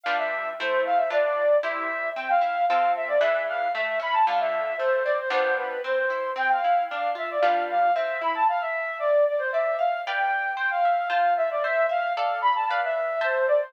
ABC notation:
X:1
M:2/4
L:1/16
Q:1/4=114
K:C
V:1 name="Flute"
f e3 c2 f e | d d3 e4 | g f3 f2 e d | e2 f2 e2 b a |
f e3 c2 d c | c2 B2 c4 | g f3 f2 e d | f2 f2 e2 b a |
f e3 d2 d c | e2 f2 g4 | g f3 f2 e d | e2 f2 f2 b a |
f e3 c2 d c |]
V:2 name="Orchestral Harp"
[G,DFB]4 [A,Ec]4 | [DFB]4 [EGc]4 | C2 E2 [CFA]4 | [E,D^GB]4 A,2 ^C2 |
[D,A,F]4 A,2 C2 | [G,B,DF]4 C2 E2 | C2 E2 D2 F2 | [G,DFB]4 C2 E2 |
z8 | d2 f2 [Bdfg]4 | c2 e2 [Fca]4 | c2 e2 [Adf]4 |
[Bdf]4 [cea]4 |]